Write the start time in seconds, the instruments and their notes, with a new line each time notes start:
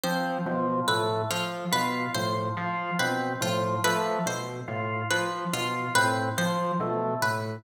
0.04 electric piano 1 F3, drawbar organ C4, pizzicato strings C5
0.46 electric piano 1 B2, drawbar organ F3
0.88 electric piano 1 A2, drawbar organ A3, pizzicato strings B4
1.30 electric piano 1 F3, pizzicato strings F4
1.71 electric piano 1 B2, drawbar organ F4, pizzicato strings B4
2.14 electric piano 1 A2, drawbar organ F3, pizzicato strings C5
2.57 electric piano 1 F3, drawbar organ F4
2.99 electric piano 1 B2, drawbar organ C4, pizzicato strings B4
3.41 electric piano 1 A2, drawbar organ F3, pizzicato strings F4
3.84 electric piano 1 F3, drawbar organ A3, pizzicato strings B4
4.26 electric piano 1 B2, pizzicato strings C5
4.68 electric piano 1 A2, drawbar organ F4
5.11 drawbar organ F3, electric piano 1 F3, pizzicato strings B4
5.53 electric piano 1 B2, drawbar organ F4, pizzicato strings F4
5.95 electric piano 1 A2, drawbar organ C4, pizzicato strings B4
6.38 electric piano 1 F3, drawbar organ F3, pizzicato strings C5
6.80 electric piano 1 B2, drawbar organ A3
7.22 electric piano 1 A2, pizzicato strings B4